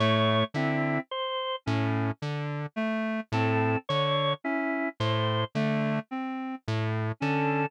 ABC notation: X:1
M:7/8
L:1/8
Q:1/4=54
K:none
V:1 name="Lead 1 (square)" clef=bass
A,, D, z A,, D, z A,, | D, z A,, D, z A,, D, |]
V:2 name="Clarinet"
A, C z ^C z A, =C | z ^C z A, =C z ^C |]
V:3 name="Drawbar Organ"
^c E =c z3 A | ^c E =c z3 A |]